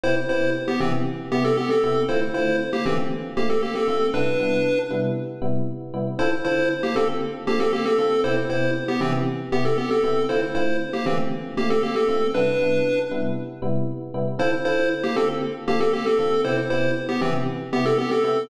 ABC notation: X:1
M:4/4
L:1/16
Q:1/4=117
K:Dm
V:1 name="Lead 1 (square)"
[Ec] z [Ec]2 z [=B,G] [E,C] z3 [B,G] [CA] [B,G] [CA]3 | [Ec] z [Ec]2 z [B,G] [E,C] z3 [B,G] [CA] [B,G] [CA]3 | [D=B]6 z10 | [Ec] z [Ec]2 z [B,G] [CA] z3 [B,G] [CA] [B,G] [CA]3 |
[Ec] z [Ec]2 z [=B,G] [E,C] z3 [B,G] [CA] [B,G] [CA]3 | [Ec] z [Ec]2 z [B,G] [E,C] z3 [B,G] [CA] [B,G] [CA]3 | [D=B]6 z10 | [Ec] z [Ec]2 z [B,G] [CA] z3 [B,G] [CA] [B,G] [CA]3 |
[Ec] z [Ec]2 z [=B,G] [E,C] z3 [B,G] [CA] [B,G] [CA]3 |]
V:2 name="Electric Piano 1"
[C,=B,EG]2 [C,B,EG]4 [C,B,EG]4 [C,B,EG]4 [C,B,EG]2 | [D,A,CF]2 [D,A,CF]4 [D,A,CF]4 [D,A,CF]4 [D,A,CF]2 | [C,G,=B,E]2 [C,G,B,E]4 [C,G,B,E]4 [C,G,B,E]4 [C,G,B,E]2 | [D,CFA]2 [D,CFA]4 [D,CFA]4 [D,CFA]4 [D,CFA]2 |
[C,=B,EG]2 [C,B,EG]4 [C,B,EG]4 [C,B,EG]4 [C,B,EG]2 | [D,A,CF]2 [D,A,CF]4 [D,A,CF]4 [D,A,CF]4 [D,A,CF]2 | [C,G,=B,E]2 [C,G,B,E]4 [C,G,B,E]4 [C,G,B,E]4 [C,G,B,E]2 | [D,CFA]2 [D,CFA]4 [D,CFA]4 [D,CFA]4 [D,CFA]2 |
[C,=B,EG]2 [C,B,EG]4 [C,B,EG]4 [C,B,EG]4 [C,B,EG]2 |]